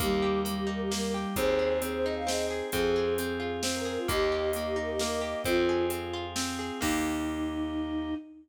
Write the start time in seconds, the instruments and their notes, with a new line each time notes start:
0.00 electric bass (finger) D#2, flute G3 G4, orchestral harp A#3, drawbar organ A#3 D#4 G4, kick, closed hi-hat
0.22 orchestral harp G4
0.45 flute G3, orchestral harp A#3, closed hi-hat
0.57 flute G4
0.67 orchestral harp D#4, flute A#4
0.80 flute G4
0.91 flute G3 A#4, orchestral harp A#3, snare
1.14 orchestral harp G4
1.36 electric bass (finger) D#2, drawbar organ C4 D#4 G#4, orchestral harp C4, flute G#4 C5, kick, closed hi-hat
1.59 orchestral harp G#4
1.82 orchestral harp C4, flute G#4, closed hi-hat
1.94 flute C5
2.04 orchestral harp D#4, flute D#5
2.16 flute F5
2.27 orchestral harp C4, flute G#4 D#5, snare
2.50 orchestral harp G#4
2.72 electric bass (finger) F2, drawbar organ C4 F4 G#4, orchestral harp C4, flute G#4, kick, closed hi-hat
2.96 orchestral harp G#4
3.18 orchestral harp C4, closed hi-hat
3.40 orchestral harp F4
3.63 orchestral harp C4, snare
3.75 flute A#4
3.85 orchestral harp G#4, flute A#4
3.98 flute F4
4.08 electric bass (finger) D#2, orchestral harp A#3, drawbar organ A#3 D#4 G4, flute G4 D#5, kick, closed hi-hat
4.32 orchestral harp G4
4.53 orchestral harp A#3, closed hi-hat
4.66 flute G4
4.76 orchestral harp D#4, flute A#4
4.89 flute G4
4.99 orchestral harp A#3, flute A#4, snare
5.21 orchestral harp G4
5.45 electric bass (finger) F2, orchestral harp C4, drawbar organ C4 F4 G#4, flute F4, kick, closed hi-hat
5.57 flute F4
5.69 orchestral harp G#4
5.90 orchestral harp C4, closed hi-hat
6.13 orchestral harp F4
6.36 orchestral harp C4, snare
6.59 orchestral harp G#4
6.81 electric bass (finger) D#2, orchestral harp A#3 D#4 G4, drawbar organ A#3 D#4 G4, flute D#4, kick, crash